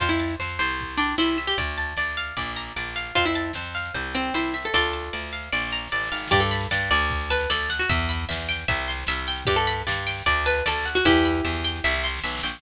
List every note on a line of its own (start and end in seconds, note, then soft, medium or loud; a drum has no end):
0.00 0.35 F2 medium
0.00 0.09 F4 loud
0.00 0.39 C5 medium
0.00 kick medium
0.00 snare medium
0.09 0.33 E4 medium
0.09 snare medium
0.19 0.76 A5 soft
0.19 snare medium
0.29 snare medium
0.40 0.58 F2 medium
0.40 0.59 C5 medium
0.40 snare loud
0.49 snare medium
0.58 1.14 C2 medium
0.58 1.18 C5 medium
0.58 snare medium
0.68 snare medium
0.78 kick medium
0.78 snare medium
0.89 snare medium
0.97 1.15 D4 medium
0.97 1.55 G5 medium
0.97 snare medium
1.07 snare medium
1.18 1.54 C2 medium
1.18 1.37 E4 medium
1.18 1.56 C5 medium
1.18 snare medium
1.30 snare medium
1.38 1.57 E5 medium
1.38 snare medium
1.47 1.57 G4 medium
1.47 snare medium
1.58 1.93 D2 medium
1.58 1.97 D5 medium
1.58 kick medium
1.58 snare medium
1.68 snare medium
1.78 2.34 A5 medium
1.78 snare medium
1.89 snare medium
1.97 2.33 D2 medium
1.97 2.35 D5 medium
1.97 snare loud
2.08 snare medium
2.17 2.36 F5 medium
2.17 snare medium
2.27 snare medium
2.37 2.72 A#1 medium
2.37 2.76 D5 medium
2.37 kick medium
2.37 snare medium
2.47 snare medium
2.56 3.13 A#5 medium
2.56 snare medium
2.67 snare medium
2.76 3.12 A#1 medium
2.76 3.14 D5 medium
2.76 snare medium
2.86 snare medium
2.96 3.15 F5 medium
2.96 snare medium
3.05 snare medium
3.15 3.51 F2 medium
3.15 3.25 F4 loud
3.15 3.55 C5 medium
3.15 kick medium
3.15 snare medium
3.25 3.50 E4 medium
3.25 snare medium
3.34 3.92 A5 medium
3.34 snare medium
3.44 snare medium
3.53 3.91 F2 medium
3.53 3.93 C5 medium
3.53 snare loud
3.65 snare medium
3.75 3.94 F5 medium
3.75 snare medium
3.85 snare medium
3.94 4.30 C2 medium
3.94 4.34 C5 medium
3.94 kick medium
3.94 snare medium
4.04 snare medium
4.14 4.33 C4 medium
4.14 4.71 G5 medium
4.14 snare medium
4.24 snare medium
4.34 4.70 C2 medium
4.34 4.53 E4 medium
4.34 4.72 C5 medium
4.34 snare loud
4.45 snare medium
4.54 4.73 E5 medium
4.54 snare medium
4.62 4.74 A4 medium
4.62 snare medium
4.73 5.09 D2 medium
4.73 5.32 F4 medium
4.73 5.32 A4 loud
4.73 5.13 D5 medium
4.73 kick medium
4.73 snare medium
4.83 snare soft
4.93 5.50 A5 medium
4.93 snare medium
5.03 snare medium
5.13 5.49 D2 medium
5.13 5.51 D5 soft
5.13 snare medium
5.23 snare medium
5.33 5.51 F5 medium
5.33 snare medium
5.42 snare medium
5.52 5.88 A#1 medium
5.52 5.92 D5 medium
5.52 snare medium
5.57 snare medium
5.63 snare medium
5.68 snare medium
5.71 6.29 A#5 medium
5.71 snare medium
5.75 snare medium
5.83 snare medium
5.87 snare medium
5.92 6.10 A1 medium
5.92 6.30 D5 medium
5.92 snare medium
5.98 snare medium
6.04 snare medium
6.07 snare medium
6.12 6.30 G#1 medium
6.12 6.30 F5 medium
6.12 snare medium
6.16 snare medium
6.22 snare medium
6.27 6.40 G4 loud
6.27 snare loud
6.31 6.67 G2 loud
6.31 6.51 D5 loud
6.31 kick loud
6.31 snare medium
6.40 6.67 A4 medium
6.40 snare medium
6.51 6.71 B5 medium
6.51 snare loud
6.60 snare medium
6.71 6.90 G2 medium
6.71 6.90 D5 medium
6.71 snare loud
6.80 snare medium
6.91 7.46 D2 loud
6.91 7.30 D5 loud
6.91 snare medium
7.00 snare medium
7.10 kick loud
7.10 snare medium
7.19 snare medium
7.30 7.49 B4 medium
7.30 7.50 A5 medium
7.30 snare loud
7.40 snare medium
7.50 7.86 D2 medium
7.50 7.69 A4 loud
7.50 7.70 D5 medium
7.50 snare loud
7.60 snare medium
7.69 7.89 F#5 medium
7.69 snare loud
7.79 7.89 F#4 loud
7.79 snare medium
7.89 8.25 E2 loud
7.89 8.09 E5 medium
7.89 kick loud
7.89 snare medium
7.98 snare medium
8.09 8.29 B5 medium
8.09 snare medium
8.19 snare medium
8.29 8.65 E2 medium
8.29 8.48 E5 medium
8.29 snare loud
8.40 snare medium
8.49 8.67 G5 medium
8.49 snare loud
8.59 snare medium
8.68 9.04 C2 loud
8.68 8.88 E5 medium
8.68 kick loud
8.68 snare loud
8.79 snare medium
8.88 9.08 C6 medium
8.88 snare loud
8.99 snare medium
9.07 9.44 C2 medium
9.07 9.28 E5 medium
9.07 snare loud
9.18 snare medium
9.27 9.47 G5 medium
9.27 snare medium
9.36 snare medium
9.45 9.83 G2 loud
9.45 9.56 G4 loud
9.45 9.67 D5 medium
9.45 kick loud
9.45 snare medium
9.56 9.82 A4 loud
9.56 snare medium
9.67 9.87 B5 medium
9.67 snare medium
9.77 snare medium
9.87 10.22 G2 medium
9.87 10.06 D5 medium
9.87 snare loud
9.95 snare medium
10.07 10.25 G5 medium
10.07 snare loud
10.18 snare medium
10.26 10.62 D2 loud
10.26 10.46 D5 medium
10.26 kick medium
10.26 snare medium
10.37 snare medium
10.45 10.64 B4 loud
10.45 10.66 A5 medium
10.45 snare medium
10.55 snare medium
10.66 11.01 D2 medium
10.66 10.87 A4 loud
10.66 10.86 D5 medium
10.66 snare loud
10.77 snare medium
10.84 11.04 F#5 medium
10.84 snare loud
10.95 11.05 F#4 loud
10.95 snare medium
11.04 11.41 E2 loud
11.04 11.91 E4 loud
11.04 11.91 G4 loud
11.04 11.25 E5 loud
11.04 kick loud
11.04 snare medium
11.16 snare medium
11.24 11.45 B5 medium
11.24 snare medium
11.35 snare medium
11.45 11.80 E2 medium
11.45 11.64 E5 medium
11.45 snare medium
11.53 snare medium
11.64 11.83 G5 medium
11.64 snare medium
11.76 snare medium
11.84 12.20 C2 loud
11.84 12.04 E5 loud
11.84 snare medium
11.90 snare medium
11.94 snare medium
11.99 snare medium
12.04 12.24 C6 medium
12.04 snare medium
12.07 snare medium
12.16 snare medium
12.19 snare loud
12.24 12.42 B1 medium
12.24 12.43 E5 medium
12.24 snare loud
12.30 snare loud
12.35 snare loud
12.39 snare loud
12.43 12.61 A#1 medium
12.43 12.62 G5 medium
12.43 snare medium
12.48 snare medium
12.55 snare loud
12.59 snare loud